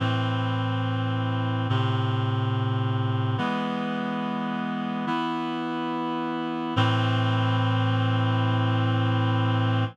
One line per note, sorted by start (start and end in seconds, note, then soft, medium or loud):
0.00 1.67 A2 medium
0.00 1.67 E3 medium
0.00 1.67 C4 medium
1.69 3.37 A2 medium
1.69 3.37 C3 medium
1.69 3.37 C4 medium
3.38 5.05 E3 medium
3.38 5.05 G#3 medium
3.38 5.05 B3 medium
5.07 6.74 E3 medium
5.07 6.74 B3 medium
5.07 6.74 E4 medium
6.76 9.84 A2 loud
6.76 9.84 E3 medium
6.76 9.84 C4 medium